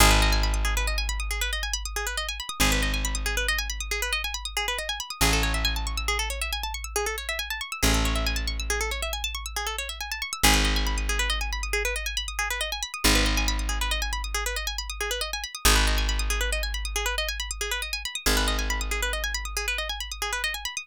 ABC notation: X:1
M:12/8
L:1/16
Q:3/8=92
K:G#phr
V:1 name="Pizzicato Strings"
G B d g b d' G B d g b d' G B d g b d' G B d g b d' | G B d g b d' G B d g b d' G B d g b d' G B d g b d' | G A c e g a c' e' G A c e g a c' e' G A c e g a c' e' | G A c e g a c' e' G A c e g a c' e' G A c e g a c' e' |
G B d g b d' G B d g b d' G B d g b d' G B d g b d' | G B d g b d' G B d g b d' G B d g b d' G B d g b d' | G B d g b d' G B d g b d' G B d g b d' G B d g b d' | G B d g b d' G B d g b d' G B d g b d' G B d g b d' |]
V:2 name="Electric Bass (finger)" clef=bass
G,,,24 | G,,,24 | A,,,24 | A,,,24 |
G,,,24 | G,,,24 | G,,,24 | G,,,24 |]